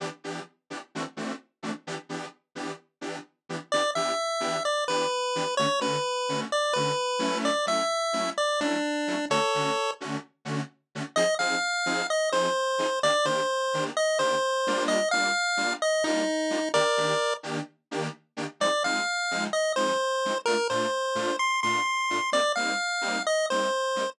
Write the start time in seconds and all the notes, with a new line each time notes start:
0.00 E3 B3 D4 G4
0.24 E3 B3 D4 G4
0.70 E3 B3 D4 G4
0.95 E3 A3 C4 D4 F#4
1.17 E3 A3 C4 D4 F#4
1.63 E3 A3 C4 D4 F#4
1.87 E3 B3 D4 G4
2.09 E3 B3 D4 G4
2.55 E3 B3 D4 G4
3.01 E3 B3 D4 G4
3.49 E3 B3 D4 G4
3.72 E3 B3 D4 G4 D5
3.95 E3 B3 D4 G4 E5
4.40 E3 B3 D4 G4
4.65 D5
4.88 E3 B3 D4 G4 B4
5.35 E3 B3 D4 G4
5.57 D3 A3 C#4 F#4 C#5
5.80 D3 A3 C#4 F#4 B4
6.29 D3 A3 C#4 F#4
6.52 D5
6.73 D3 A3 C#4 F#4 B4
7.19 F#3 A3 C#4 E4
7.45 D5
7.66 F#3 A3 C#4 E4 E5
8.13 F#3 A3 C#4 E4
8.38 D5
8.60 F#3 A3 C#4 D4 E4
9.07 F#3 A3 C#4 E4
9.30 D3 A3 C#4 F#4 A4 C#5
9.55 D3 A3 C#4 F#4
10.00 D3 A3 C#4 F#4
10.45 D3 A3 C#4 F#4
10.95 D3 A3 C#4 F#4
11.16 F3 C4 D#4 G#4 D#5
11.39 F3 C4 D#4 G#4 F5
11.86 F3 C4 D#4 G#4
12.10 D#5
12.32 F3 C4 D#4 G#4 C5
12.79 F3 C4 D#4 G#4
13.03 D#3 A#3 D4 G4 D5
13.25 D#3 A#3 D4 G4 C5
13.74 D#3 A#3 D4 G4
13.97 D#5
14.19 D#3 A#3 D4 G4 C5
14.67 G3 A#3 D4 F4
14.88 D#5
15.11 G3 A#3 D4 F4 F5
15.57 G3 A#3 D4 F4
15.82 D#5
16.04 G3 A#3 D4 D#4 F4
16.50 G3 A#3 D4 F4
16.74 D#3 A#3 D4 G4 A#4 D5
16.97 D#3 A#3 D4 G4
17.43 D#3 A#3 D4 G4
17.91 D#3 A#3 D4 G4
18.37 D#3 A#3 D4 G4
18.60 F3 G#3 C4 D#4 D5
18.84 F3 G#3 C4 D#4 F5
19.31 F3 G#3 C4 D#4
19.53 D#5
19.76 F3 G#3 C4 D#4 C5
20.25 F3 G#3 C4 D#4
20.46 A#2 A3 D4 F4 A#4
20.70 A#2 A3 D4 F4 C5
21.15 A#2 A3 D4 F4
21.39 C6
21.63 A#2 A3 D4 F4 C6
22.10 A#2 A3 D4 F4
22.32 G3 A#3 C4 D#4 D5
22.56 G3 A#3 C4 D#4 F5
23.01 G3 A#3 C4 D#4
23.27 D#5
23.50 G3 A#3 C4 D#4 C5
23.96 G3 A#3 C4 D#4